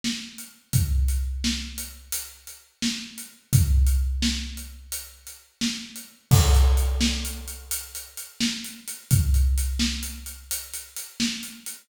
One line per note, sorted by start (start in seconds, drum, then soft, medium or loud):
0.04 snare loud
0.38 closed hi-hat medium
0.73 kick loud
0.73 closed hi-hat loud
1.08 closed hi-hat medium
1.44 snare loud
1.78 closed hi-hat loud
2.12 closed hi-hat loud
2.47 closed hi-hat medium
2.82 snare loud
3.18 closed hi-hat medium
3.53 kick loud
3.53 closed hi-hat loud
3.87 closed hi-hat medium
4.22 snare loud
4.57 closed hi-hat medium
4.92 closed hi-hat loud
5.27 closed hi-hat medium
5.61 snare loud
5.96 closed hi-hat medium
6.31 kick loud
6.31 crash loud
6.55 closed hi-hat medium
6.77 closed hi-hat medium
7.01 snare loud
7.25 closed hi-hat medium
7.48 closed hi-hat medium
7.71 closed hi-hat loud
7.95 closed hi-hat medium
8.17 closed hi-hat medium
8.41 snare loud
8.64 closed hi-hat medium
8.88 closed hi-hat medium
9.11 kick loud
9.11 closed hi-hat loud
9.34 closed hi-hat medium
9.58 closed hi-hat loud
9.79 snare loud
10.03 closed hi-hat medium
10.26 closed hi-hat medium
10.51 closed hi-hat loud
10.74 closed hi-hat medium
10.97 closed hi-hat loud
11.20 snare loud
11.43 closed hi-hat medium
11.66 closed hi-hat medium